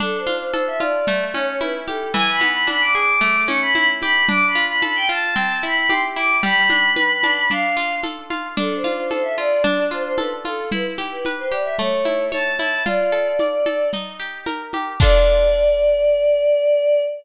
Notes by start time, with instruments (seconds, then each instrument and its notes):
0.00 acoustic guitar (steel) D4, choir aahs A4, low conga, shaker
0.18 choir aahs C5
0.27 acoustic guitar (steel) F4, high conga, shaker
0.37 choir aahs C5
0.52 acoustic guitar (steel) A4, choir aahs C5, tambourine, high conga, shaker
0.67 choir aahs E5
0.79 acoustic guitar (steel) F4, choir aahs D5, high conga, shaker
1.07 acoustic guitar (steel) A3, low conga, shaker
1.33 acoustic guitar (steel) C#4, choir aahs C#5, high conga, shaker
1.47 choir aahs C#5
1.60 acoustic guitar (steel) E4, choir aahs B4, tambourine, high conga, shaker
1.87 acoustic guitar (steel) G4, choir aahs A4, high conga, shaker
2.13 acoustic guitar (steel) E3, choir aahs G#5, low conga, shaker
2.30 choir aahs B5
2.41 acoustic guitar (steel) B3, high conga, shaker
2.50 choir aahs B5
2.67 acoustic guitar (steel) D4, choir aahs B5, tambourine, high conga, shaker
2.81 choir aahs D6
2.94 acoustic guitar (steel) G#4, choir aahs D6, shaker
3.21 acoustic guitar (steel) A3, low conga, shaker
3.48 acoustic guitar (steel) C#4, choir aahs C#6, high conga, shaker
3.61 choir aahs B5
3.74 acoustic guitar (steel) E4, choir aahs B5, tambourine, high conga, shaker
4.01 acoustic guitar (steel) G4, choir aahs B5, high conga, shaker
4.28 acoustic guitar (steel) D4, choir aahs D6, low conga, shaker
4.47 choir aahs B5
4.55 acoustic guitar (steel) F4, shaker
4.65 choir aahs B5
4.82 acoustic guitar (steel) A4, choir aahs B5, tambourine, high conga, shaker
4.95 choir aahs G5
5.09 acoustic guitar (steel) F4, choir aahs A5, shaker
5.35 acoustic guitar (steel) C4, low conga, shaker
5.62 acoustic guitar (steel) E4, choir aahs B5, shaker
5.77 choir aahs B5
5.89 acoustic guitar (steel) G4, choir aahs C6, tambourine, high conga, shaker
6.16 acoustic guitar (steel) E4, choir aahs D6, shaker
6.43 acoustic guitar (steel) G3, choir aahs B5, low conga, shaker
6.70 acoustic guitar (steel) D4, high conga, shaker
6.96 acoustic guitar (steel) B4, tambourine, high conga, shaker
7.23 acoustic guitar (steel) D4, high conga, shaker
7.50 acoustic guitar (steel) D4, choir aahs F5, low conga, shaker
7.76 acoustic guitar (steel) F4, shaker
8.03 acoustic guitar (steel) A4, tambourine, high conga, shaker
8.30 acoustic guitar (steel) F4, high conga, shaker
8.57 acoustic guitar (steel) D4, choir aahs A4, low conga, shaker
8.76 choir aahs C5
8.84 acoustic guitar (steel) F4, high conga, shaker
8.94 choir aahs C5
9.10 acoustic guitar (steel) A4, choir aahs C5, tambourine, high conga, shaker
9.23 choir aahs E5
9.37 acoustic guitar (steel) F4, choir aahs D5, shaker
9.64 acoustic guitar (steel) D4, low conga, shaker
9.91 acoustic guitar (steel) F4, choir aahs C5, shaker
10.03 choir aahs C5
10.17 acoustic guitar (steel) A4, choir aahs B4, tambourine, high conga, shaker
10.45 acoustic guitar (steel) F4, choir aahs A4, high conga, shaker
10.71 acoustic guitar (steel) E4, choir aahs B4, low conga, shaker
10.98 acoustic guitar (steel) G4, high conga, shaker
11.12 choir aahs B4
11.25 acoustic guitar (steel) B4, tambourine, high conga, shaker
11.39 choir aahs C5
11.50 acoustic guitar (steel) G4, choir aahs D5, shaker
11.64 choir aahs E5
11.78 acoustic guitar (steel) A3, choir aahs C#5, low conga, shaker
12.05 acoustic guitar (steel) E4, high conga, shaker
12.32 acoustic guitar (steel) C#5, choir aahs A5, tambourine, high conga, shaker
12.58 acoustic guitar (steel) E4, choir aahs A5, high conga, shaker
12.85 acoustic guitar (steel) F4, choir aahs D5, low conga, shaker
13.12 acoustic guitar (steel) A4, shaker
13.39 acoustic guitar (steel) D5, tambourine, high conga, shaker
13.66 acoustic guitar (steel) A4, high conga, shaker
13.93 acoustic guitar (steel) D#4, low conga, shaker
14.19 acoustic guitar (steel) G4, shaker
14.46 acoustic guitar (steel) A#4, tambourine, high conga, shaker
14.73 acoustic guitar (steel) G4, high conga, shaker
15.00 acoustic guitar (steel) D4 F4 A4, choir aahs D5, kick, crash